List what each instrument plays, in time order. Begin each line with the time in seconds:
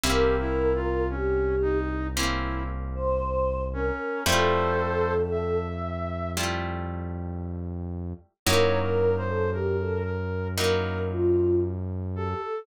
0.04 synth bass 1 C2, acoustic guitar (steel) A#3 C4 C#4 E4, brass section G4, choir aahs A#4
0.40 brass section E4
0.75 brass section F4
1.09 brass section C#4, choir aahs G4
1.62 brass section D#4
2.15 acoustic guitar (steel) A#3 C4 C#4 E4, brass section E4
2.95 choir aahs C5
3.73 brass section C#4, choir aahs A#4
4.26 synth bass 1 F2, acoustic guitar (steel) G3 A3 E4 F4, brass section A4 C5, choir aahs A4
5.31 brass section E5
6.37 acoustic guitar (steel) G3 A3 E4 F4
8.46 synth bass 1 F#2, acoustic guitar (steel) F#3 A#3 D#4 E4, choir aahs A#4, brass section C#5
8.82 brass section A#4
9.17 brass section C5
9.28 choir aahs A4
9.52 choir aahs G4, brass section A#4
9.80 choir aahs A4
10.04 brass section A#4
10.56 acoustic guitar (steel) F#3 A#3 D#4 E4, choir aahs A#4, brass section A#4
11.10 choir aahs F4
12.15 choir aahs G4, brass section A4
12.41 choir aahs A4